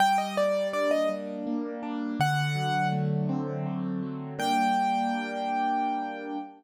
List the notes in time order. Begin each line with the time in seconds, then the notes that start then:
0.00 G3 G5
0.18 D#5
0.36 A#3 D5
0.73 D4 D5
0.91 D#5
1.09 G3
1.47 A#3
1.83 D4
2.20 D3 F#5
2.55 F#3
2.92 A3
3.29 C4
3.66 D3
4.02 F#3
4.39 G3 A#3 D4 G5